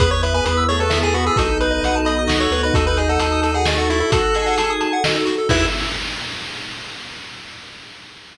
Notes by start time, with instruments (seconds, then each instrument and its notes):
0.00 synth bass 1 E2, pad 2 (warm) B3 E4 G#4, drawbar organ B3, lead 1 (square) G#4 B4, kick, closed hi-hat
0.11 lead 1 (square) B4 C#5
0.23 lead 1 (square) B4 E5, closed hi-hat
0.34 drawbar organ B3, lead 1 (square) B4 G#5
0.45 synth bass 1 E2, drawbar organ B3, lead 1 (square) B4 B5, closed hi-hat
0.57 lead 1 (square) E6
0.69 drawbar organ A3, lead 1 (square) G#4 C#5, closed hi-hat
0.80 lead 1 (square) A4 B4
0.90 drawbar organ B3, lead 1 (square) E5, snare
1.03 drawbar organ A3, lead 1 (square) G#4 G#5
1.14 drawbar organ B3, lead 1 (square) F#4 B5, closed hi-hat
1.26 lead 1 (square) G#4 E6
1.36 synth bass 1 B1, pad 2 (warm) B3 D#4 F#4 A4, drawbar organ D#4, lead 1 (square) F#4 A4, kick, closed hi-hat
1.49 lead 1 (square) A4
1.60 lead 1 (square) B4, closed hi-hat
1.71 lead 1 (square) D#5
1.83 synth bass 1 B1, lead 1 (square) F#5, closed hi-hat
1.95 lead 1 (square) A5
2.05 lead 1 (square) D#5 B5, closed hi-hat
2.19 lead 1 (square) D#6
2.27 synth bass 1 C#2, lead 1 (square) F#4, drawbar organ F#4, snare
2.40 lead 1 (square) A4 C#5
2.51 synth bass 1 D2, lead 1 (square) B4, closed hi-hat
2.63 lead 1 (square) B4 D#5
2.74 synth bass 1 D#2, pad 2 (warm) D#4 F#4 A4, drawbar organ D#4, lead 1 (square) F#4 A4, kick, closed hi-hat
2.86 lead 1 (square) A4 B4
2.97 lead 1 (square) G#4 D#5, closed hi-hat
3.09 lead 1 (square) A4 F#5
3.19 synth bass 1 D#2, lead 1 (square) A4 A5, closed hi-hat
3.32 lead 1 (square) D#6
3.42 lead 1 (square) A4 A5, closed hi-hat
3.54 lead 1 (square) G#4 F#5
3.66 drawbar organ A3, lead 1 (square) D#5, snare
3.76 lead 1 (square) F#4 A4
3.90 lead 1 (square) E4 F#4, closed hi-hat
4.00 lead 1 (square) E4 A4
4.10 pad 2 (warm) D#4 F#4 A4, lead 1 (square) F#4 A4, drawbar organ F#4, kick, closed hi-hat
4.24 lead 1 (square) A4
4.35 drawbar organ G#4, lead 1 (square) D#5, closed hi-hat
4.46 lead 1 (square) F#5
4.58 lead 1 (square) A5, closed hi-hat
4.70 lead 1 (square) D#6
4.81 lead 1 (square) A5, closed hi-hat
4.93 lead 1 (square) F#5
5.04 lead 1 (square) D#5, snare
5.14 lead 1 (square) A4
5.25 lead 1 (square) F#4, closed hi-hat
5.38 lead 1 (square) A4
5.49 synth bass 1 E2, pad 2 (warm) B3 E4 G#4, drawbar organ E4, lead 1 (square) E4 G#4 B4 E5, kick, crash